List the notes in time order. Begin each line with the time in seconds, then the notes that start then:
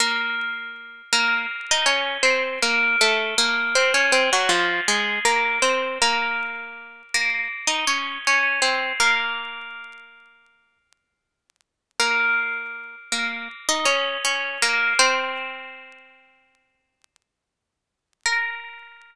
0.00 A#3 A#4
1.12 A#3 A#4
1.71 D#4 D#5
1.86 C#4 C#5
2.23 C4 C5
2.62 A#3 A#4
3.01 A3 A4
3.38 A#3 A#4
3.75 C4 C5
3.94 C#4 C#5
4.12 C4 C5
4.33 F#3 F#4
4.49 F3 F4
4.88 G#3 G#4
5.25 A#3 A#4
5.62 C4 C5
6.02 A#3 A#4
7.14 A#3 A#4
7.67 D#4 D#5
7.87 C#4 C#5
8.27 C#4 C#5
8.62 C4 C5
9.00 A#3 A#4
11.99 A#3 A#4
13.12 A#3 A#4
13.68 D#4 D#5
13.85 C#4 C#5
14.25 C#4 C#5
14.62 A#3 A#4
14.99 C4 C5
18.26 A#4